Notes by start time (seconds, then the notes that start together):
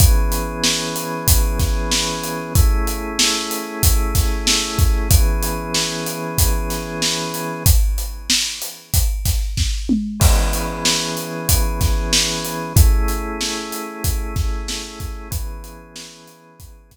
0.00 E3 B3 C#4 G#4, kick, closed hi-hat
0.32 closed hi-hat
0.64 snare
0.96 closed hi-hat
1.28 kick, closed hi-hat
1.59 kick, snare, closed hi-hat
1.91 snare
2.24 closed hi-hat
2.55 A3 C#4 E4 G#4, kick, closed hi-hat
2.87 closed hi-hat
3.19 snare
3.51 closed hi-hat
3.83 kick, closed hi-hat
4.15 kick, snare, closed hi-hat
4.47 snare
4.79 kick, closed hi-hat
5.10 E3 B3 C#4 G#4, kick, closed hi-hat
5.43 closed hi-hat
5.74 snare
6.06 closed hi-hat
6.38 kick, closed hi-hat
6.70 snare, closed hi-hat
7.02 snare
7.34 closed hi-hat
7.66 kick, closed hi-hat
7.98 closed hi-hat
8.30 snare
8.62 closed hi-hat
8.94 kick, closed hi-hat
9.25 kick, snare, closed hi-hat
9.57 kick, snare
9.89 mid tom
10.20 E3 B3 C#4 G#4, kick, crash
10.53 closed hi-hat
10.85 snare
11.17 closed hi-hat
11.49 kick, closed hi-hat
11.81 kick, snare, closed hi-hat
12.13 snare
12.45 closed hi-hat
12.76 A3 C#4 E4 G#4, kick, closed hi-hat
13.08 closed hi-hat
13.41 snare
13.72 closed hi-hat
14.04 kick, closed hi-hat
14.36 kick, snare, closed hi-hat
14.68 snare
15.00 kick, snare, closed hi-hat
15.31 E3 B3 C#4 G#4, kick, closed hi-hat
15.64 closed hi-hat
15.96 snare
16.28 closed hi-hat
16.60 kick, closed hi-hat
16.91 kick, snare, closed hi-hat